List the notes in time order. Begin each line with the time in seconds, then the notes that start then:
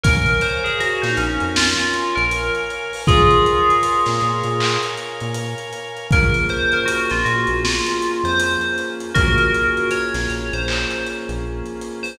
0.03 A#1 A#4 C#5 F5 G#5, kick, closed hi-hat
0.26 closed hi-hat
0.41 C5, closed hi-hat
0.64 G#4, closed hi-hat
0.80 F#4, closed hi-hat
1.02 A#2 D#4, snare, closed hi-hat
1.17 A#1 C#4, closed hi-hat
1.40 F2, closed hi-hat
1.56 F4, snare
1.79 closed hi-hat
1.94 closed hi-hat
2.15 A#1 A#4, closed hi-hat
2.31 closed hi-hat
2.55 closed hi-hat
2.70 closed hi-hat
2.93 open hi-hat
3.07 A#1 F4 G#4 A#4 C#5 F5 G#5, kick, closed hi-hat
3.31 closed hi-hat
3.46 closed hi-hat
3.70 closed hi-hat
3.83 closed hi-hat
4.06 A#2, snare, closed hi-hat
4.21 A#2, closed hi-hat
4.44 A#2, closed hi-hat
4.60 clap
4.83 closed hi-hat
4.97 closed hi-hat
5.20 A#2, closed hi-hat
5.34 closed hi-hat
5.58 closed hi-hat
5.73 closed hi-hat
5.97 closed hi-hat
6.11 A#1 A#3 C#4 F4 G#4 A#4, kick, closed hi-hat
6.34 closed hi-hat
6.49 C5, closed hi-hat
6.72 A#4, closed hi-hat
6.85 F#4, closed hi-hat
7.10 A#1 F4, snare, closed hi-hat
7.25 A#2 F#4, closed hi-hat
7.47 A#1, closed hi-hat
7.64 F4, snare
7.87 closed hi-hat
8.02 closed hi-hat
8.24 F2 C5, closed hi-hat
8.40 closed hi-hat
8.61 closed hi-hat
8.78 closed hi-hat
9.00 closed hi-hat
9.15 A#1 A#3 C#4 F4 F#4 G#4 A#4, kick, closed hi-hat
9.38 closed hi-hat
9.54 closed hi-hat
9.77 closed hi-hat
9.91 C#5, closed hi-hat
10.14 A#1, snare, closed hi-hat
10.30 A#1, closed hi-hat
10.53 A#1 C5, closed hi-hat
10.68 clap
10.91 closed hi-hat
11.06 closed hi-hat
11.29 A#1, closed hi-hat
11.66 closed hi-hat
11.81 closed hi-hat
12.03 C5, open hi-hat